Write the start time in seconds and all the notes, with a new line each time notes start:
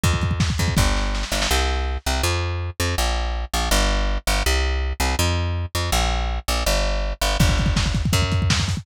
0.04 F2, kick, closed hi-hat
0.13 kick
0.22 kick, closed hi-hat
0.31 kick
0.40 kick, snare
0.50 kick
0.58 F2, kick, closed hi-hat
0.68 kick
0.77 G1, kick, snare
0.97 snare
1.15 snare
1.23 snare
1.32 G1, snare
1.42 snare
1.51 C2
2.06 C2
2.23 F2
2.80 F2
2.98 A#1
3.54 A#1
3.71 G1
4.27 G1
4.46 C2
5.00 C2
5.19 F2
5.75 F2
5.92 A#1
6.48 A#1
6.66 G1
7.21 G1
7.40 G1, kick, crash
7.49 kick
7.58 kick, closed hi-hat
7.66 kick
7.76 kick, snare
7.86 kick
7.94 kick, closed hi-hat
8.05 kick
8.13 F#2, kick, closed hi-hat
8.22 kick
8.32 kick, closed hi-hat
8.42 kick
8.50 kick, snare
8.60 kick
8.68 kick, open hi-hat
8.77 kick